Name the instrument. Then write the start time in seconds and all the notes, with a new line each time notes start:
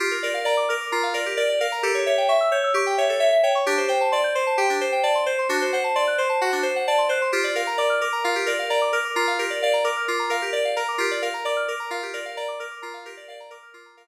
electric piano 2
0.00 F4 G4
0.11 A#4
0.23 A#4 D5
0.34 F5
0.45 D5 A#5
0.57 D6
0.69 A#4 F6
0.80 D6
0.92 F4 A#5
1.03 F5
1.14 A#4 D5
1.26 G4
1.37 A#4 D5
1.49 D5
1.60 A#4 F5
1.72 A#5
1.83 G4 A4
1.94 C#5
2.06 C#5 E5
2.18 G5
2.28 E5 C#6
2.41 E6
2.52 C#5 G6
2.64 E6
2.74 G4 C#6
2.86 G5
2.98 C#5 E5
3.09 A4
3.20 C#5 E5
3.32 E5
3.43 C#5 G5
3.55 C#6
3.66 D4 G4
3.78 C5
3.88 C5 G5
4.01 A5
4.12 D5 C6
4.24 G6
4.35 C5 C6
4.47 A5
4.58 G4 G5
4.70 D4
4.81 C5
4.92 G5
5.03 D5 A5
5.15 C6
5.26 C5 G6
5.39 C6
5.49 D4 F#4
5.62 C5
5.73 C5 F#5
5.84 A5
5.95 D5 C6
6.07 F#6
6.18 C5 C6
6.29 A5
6.41 F#4 F#5
6.52 D4
6.63 C5
6.76 F#5
6.87 D5 A5
6.98 C6
7.09 C5 F#6
7.22 C6
7.32 F4 G4
7.44 D5
7.55 A#4 F5
7.67 A#5
7.78 D5 D6
7.90 F6
8.01 A#4 D6
8.12 A#5
8.24 F4 F5
8.35 G4
8.46 A#4 D5
8.59 F5
8.70 D5 A#5
8.81 D6
8.93 A#4 F6
9.05 D6
9.16 F4 A#5
9.27 F5
9.39 G4 A#4
9.50 D5
9.62 D5 F5
9.73 A#5
9.84 A#4 D6
9.97 F6
10.08 F4 D6
10.19 A#5
10.30 A#4 F5
10.42 G4
10.53 D5
10.65 F5
10.76 A#4 A#5
10.88 D6
10.98 F4 G4
11.11 D5
11.22 A#4 F5
11.34 A#5
11.45 D5 D6
11.57 F6
11.68 A#4 D6
11.80 A#5
11.91 F4 F5
12.03 G4
12.13 A#4 D5
12.25 F5
12.37 D5 A#5
12.48 D6
12.59 A#4 F6
12.71 D6
12.82 F4 A#5
12.94 F5
13.05 G4 A#4
13.17 D5
13.28 D5 F5
13.40 A#5
13.50 A#4 D6
13.63 F6
13.74 F4 D6
13.86 A#5
13.97 A#4 F5